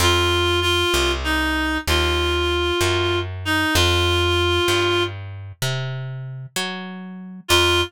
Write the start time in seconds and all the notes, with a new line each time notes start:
0.00 F2 F4
0.61 F4
0.94 C2
1.24 D#4
1.88 D#2 F4
2.81 F#2
3.45 D#4
3.75 F2 F4
4.68 G2
5.62 C3
6.56 F#3
7.48 F2 F4